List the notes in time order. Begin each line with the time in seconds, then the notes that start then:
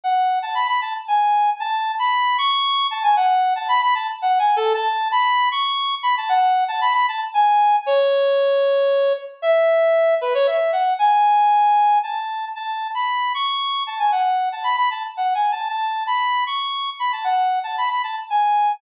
0.04 F#5
0.42 A5
0.55 B5
0.68 B5
0.81 A5
1.08 G#5
1.60 A5
1.99 B5
2.38 C#6
2.91 A5
3.03 G#5
3.16 F#5
3.56 A5
3.68 B5
3.82 B5
3.95 A5
4.22 F#5
4.39 G#5
4.56 A4
4.74 A5
5.12 B5
5.52 C#6
6.03 B5
6.17 A5
6.29 F#5
6.68 A5
6.81 B5
6.94 B5
7.08 A5
7.34 G#5
7.86 C#5
9.42 E5
10.21 B4
10.34 C#5
10.47 E5
10.72 F#5
10.99 G#5
12.03 A5
12.55 A5
12.95 B5
13.34 C#6
13.87 A5
13.99 G#5
14.12 F#5
14.52 A5
14.64 B5
14.77 B5
14.91 A5
15.17 F#5
15.35 G#5
15.52 A5
15.69 A5
16.07 B5
16.47 C#6
16.99 B5
17.12 A5
17.24 F#5
17.64 A5
17.78 B5
17.90 B5
18.03 A5
18.30 G#5